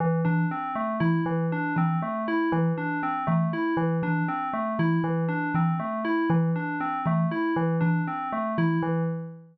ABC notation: X:1
M:3/4
L:1/8
Q:1/4=119
K:none
V:1 name="Kalimba" clef=bass
z E, z2 E, z | z E, z2 E, z | z E, z2 E, z | z E, z2 E, z |
z E, z2 E, z | z E, z2 E, z |]
V:2 name="Tubular Bells"
E, D C A, E E, | D C A, E E, D | C A, E E, D C | A, E E, D C A, |
E E, D C A, E | E, D C A, E E, |]